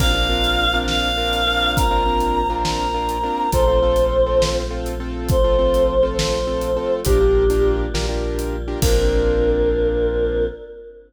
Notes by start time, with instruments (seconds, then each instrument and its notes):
0.00 synth bass 2 A#1, choir aahs A#3 C4 D4 F4 F5, acoustic grand piano C4 D4 F4 A#4, kick, crash
0.15 acoustic grand piano C4 D4 F4 A#4
0.30 acoustic grand piano C4 D4 F4 A#4
0.44 closed hi-hat
0.74 acoustic grand piano C4 D4 F4 A#4
0.88 choir aahs F5, snare
1.18 acoustic grand piano C4 D4 F4 A#4
1.33 closed hi-hat
1.47 acoustic grand piano C4 D4 F4 A#4
1.76 choir aahs A#3 C4 F4 A#4 A#5, kick, closed hi-hat
1.91 acoustic grand piano C4 D4 F4 A#4
2.06 acoustic grand piano C4 D4 F4 A#4
2.20 closed hi-hat
2.50 acoustic grand piano C4 D4 F4 A#4
2.65 choir aahs A#5, snare
2.94 acoustic grand piano C4 D4 F4 A#4
3.09 closed hi-hat
3.24 acoustic grand piano C4 D4 F4 A#4
3.52 synth bass 2 A#1, choir aahs A3 C4 F4 C5, acoustic grand piano C4 F4 A4, kick, closed hi-hat
3.68 acoustic grand piano C4 F4 A4
3.82 acoustic grand piano C4 F4 A4
3.96 closed hi-hat
4.26 acoustic grand piano C4 F4 A4
4.42 snare
4.70 acoustic grand piano C4 F4 A4
4.86 closed hi-hat
5.00 acoustic grand piano C4 F4 A4
5.29 choir aahs F3 A3 F4 C5, kick, closed hi-hat
5.44 acoustic grand piano C4 F4 A4
5.59 acoustic grand piano C4 F4 A4
5.74 closed hi-hat
6.03 acoustic grand piano C4 F4 A4
6.17 choir aahs C5, snare
6.47 acoustic grand piano C4 F4 A4
6.61 closed hi-hat
6.76 acoustic grand piano C4 F4 A4
7.05 synth bass 2 A#1, choir aahs G3 A#3 D4 F4 G4, acoustic grand piano D4 F4 G4 A#4, kick, closed hi-hat
7.20 acoustic grand piano D4 F4 G4 A#4
7.50 acoustic grand piano D4 F4 G4 A#4, closed hi-hat
7.94 synth bass 2 A#1, choir aahs G3 A#3 F4 G4, acoustic grand piano D4 F4 G4 A#4, snare
8.09 acoustic grand piano D4 F4 G4 A#4
8.39 closed hi-hat
8.68 acoustic grand piano D4 F4 G4 A#4
8.82 synth bass 2 A#1, choir aahs A#3 C4 D4 F4 A#4, acoustic grand piano C4 D4 F4 A#4, kick, crash